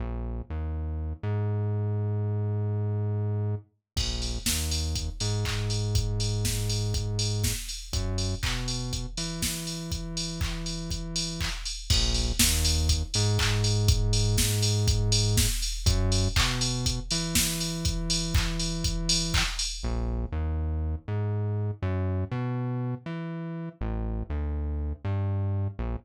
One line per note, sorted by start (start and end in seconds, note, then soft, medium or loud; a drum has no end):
0.00 0.42 A#1 medium
0.50 1.13 D#2 medium
1.23 3.55 G#2 medium
3.96 4.39 A#1 loud
3.96 kick medium
3.96 crash medium
4.22 open hi-hat medium
4.46 5.09 D#2 medium
4.46 kick medium
4.46 snare medium
4.71 open hi-hat medium
4.95 kick medium
4.95 closed hi-hat medium
5.20 7.53 G#2 medium
5.20 open hi-hat medium
5.45 kick medium
5.45 clap medium
5.70 open hi-hat medium
5.95 kick medium
5.95 closed hi-hat medium
6.20 open hi-hat medium
6.45 kick medium
6.45 snare medium
6.70 open hi-hat medium
6.94 kick medium
6.94 closed hi-hat medium
7.19 open hi-hat medium
7.44 kick medium
7.44 snare medium
7.69 open hi-hat medium
7.93 8.35 F#2 loud
7.93 kick medium
7.93 closed hi-hat medium
8.18 open hi-hat medium
8.43 9.06 B2 medium
8.43 kick medium
8.43 clap loud
8.68 open hi-hat medium
8.93 kick medium
8.93 closed hi-hat medium
9.17 11.49 E3 medium
9.17 open hi-hat medium
9.42 kick medium
9.42 snare medium
9.67 open hi-hat medium
9.92 kick medium
9.92 closed hi-hat medium
10.17 open hi-hat medium
10.41 kick medium
10.41 clap medium
10.66 open hi-hat medium
10.90 kick medium
10.90 closed hi-hat medium
11.16 open hi-hat medium
11.40 kick medium
11.40 clap medium
11.65 open hi-hat medium
11.90 12.33 A#1 loud
11.90 kick loud
11.90 crash loud
12.14 open hi-hat medium
12.39 13.03 D#2 loud
12.39 kick medium
12.39 snare loud
12.65 open hi-hat medium
12.89 kick medium
12.89 closed hi-hat loud
13.14 15.47 G#2 loud
13.14 open hi-hat medium
13.39 kick medium
13.39 clap loud
13.64 open hi-hat medium
13.88 kick loud
13.88 closed hi-hat loud
14.13 open hi-hat medium
14.38 kick medium
14.38 snare medium
14.62 open hi-hat medium
14.88 kick loud
14.88 closed hi-hat loud
15.12 open hi-hat loud
15.37 kick loud
15.37 snare loud
15.62 open hi-hat medium
15.86 16.28 F#2 loud
15.86 kick loud
15.86 closed hi-hat loud
16.12 open hi-hat medium
16.36 17.00 B2 loud
16.36 kick loud
16.36 clap loud
16.61 open hi-hat medium
16.86 kick medium
16.86 closed hi-hat loud
17.11 19.43 E3 medium
17.11 open hi-hat medium
17.35 kick medium
17.35 snare loud
17.60 open hi-hat medium
17.85 kick medium
17.85 closed hi-hat medium
18.10 open hi-hat medium
18.35 kick loud
18.35 clap loud
18.60 open hi-hat medium
18.84 kick medium
18.84 closed hi-hat loud
19.09 open hi-hat loud
19.34 kick medium
19.34 clap loud
19.59 open hi-hat medium
19.83 20.26 A#1 loud
20.32 20.95 D#2 medium
21.08 21.71 G#2 medium
21.82 22.24 F#2 loud
22.31 22.95 B2 loud
23.06 23.69 E3 medium
23.81 24.23 A1 loud
24.30 24.93 D2 medium
25.05 25.68 G2 loud
25.79 25.96 A#1 loud